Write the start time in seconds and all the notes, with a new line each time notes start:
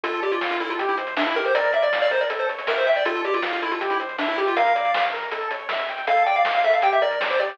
0.04 D2 F4 A4, kick, closed hi-hat
0.13 closed hi-hat
0.22 G4 D5, closed hi-hat
0.32 F4, closed hi-hat
0.41 F5, snare
0.51 F4, closed hi-hat
0.60 E4 A4, closed hi-hat
0.70 F4, closed hi-hat
0.79 C2 G4, kick, closed hi-hat
0.89 E4, closed hi-hat
0.98 C5, closed hi-hat
1.07 closed hi-hat
1.17 D4 E5, snare
1.26 E4, closed hi-hat
1.36 G4 A#4, closed hi-hat
1.45 C5, closed hi-hat
1.54 A#1 A#4 D5, kick, closed hi-hat
1.64 kick, closed hi-hat
1.73 D5 E5, closed hi-hat
1.82 D5, closed hi-hat
1.92 F5, snare
2.02 D5, closed hi-hat
2.11 A#4 C5, closed hi-hat
2.21 D5, closed hi-hat
2.30 A1 A4, kick, closed hi-hat
2.39 C5, closed hi-hat
2.49 C#5, closed hi-hat
2.58 closed hi-hat
2.67 A#4 E5, snare
2.77 C5, closed hi-hat
2.87 E5 G5, closed hi-hat
2.96 D5, closed hi-hat
3.05 D2 F4 A4, kick, closed hi-hat
3.15 closed hi-hat
3.24 G4 D5, closed hi-hat
3.34 F4, closed hi-hat
3.42 F5, snare
3.53 F4, closed hi-hat
3.62 E4 A4, closed hi-hat
3.72 F4, closed hi-hat
3.80 C2 G4, kick, closed hi-hat
3.90 E4, closed hi-hat
4.00 C5, closed hi-hat
4.09 closed hi-hat
4.18 D4 E5, snare
4.28 E4, closed hi-hat
4.37 G4, closed hi-hat
4.47 F4, closed hi-hat
4.56 A#1 A#4 F5, kick, closed hi-hat
4.66 kick, closed hi-hat
4.75 D5, closed hi-hat
4.85 closed hi-hat
4.94 F5, snare
5.03 closed hi-hat
5.12 A#4, closed hi-hat
5.22 closed hi-hat
5.31 A1 A4, kick, closed hi-hat
5.41 closed hi-hat
5.51 C#5, closed hi-hat
5.59 closed hi-hat
5.69 E5, snare
5.79 closed hi-hat
5.89 G5, closed hi-hat
5.98 closed hi-hat
6.07 D2 A4 F5, kick, closed hi-hat
6.17 closed hi-hat
6.26 D5 G5, closed hi-hat
6.36 F5, closed hi-hat
6.45 F5, snare
6.54 F5, closed hi-hat
6.64 A4 E5, closed hi-hat
6.73 F5, closed hi-hat
6.82 A#1 G4 G5, kick, closed hi-hat
6.92 E5, closed hi-hat
7.01 A#4 D5, closed hi-hat
7.11 closed hi-hat
7.21 D5, snare
7.30 C5, closed hi-hat
7.39 G4 D5, closed hi-hat
7.49 closed hi-hat